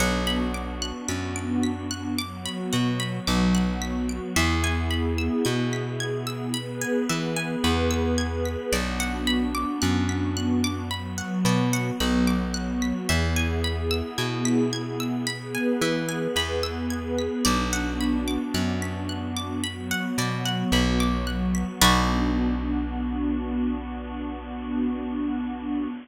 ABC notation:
X:1
M:4/4
L:1/16
Q:1/4=55
K:Bdor
V:1 name="Orchestral Harp"
f b d' f' b' d'' b' f' d' b f b d' f' b' d'' | e g b e' g' b' g' e' b g e g b e' g' b' | d f b d' f' b' f' d' b f d f b d' f' b' | e g b e' g' b' g' e' b g e g b e' g' b' |
d f b d' f' b' f' d' b f d f b d' f' b' | [FBd]16 |]
V:2 name="Pad 2 (warm)"
[B,DF]8 [F,B,F]8 | [B,EG]8 [B,GB]8 | [B,DF]8 [F,B,F]8 | [B,EG]8 [B,GB]8 |
[B,DF]8 [F,B,F]8 | [B,DF]16 |]
V:3 name="Electric Bass (finger)" clef=bass
B,,,4 F,,6 B,,2 B,,,4 | E,,4 B,,6 E,2 E,,4 | B,,,4 F,,6 B,,2 B,,,4 | E,,4 B,,6 E,2 E,,4 |
B,,,4 F,,6 B,,2 B,,,4 | B,,,16 |]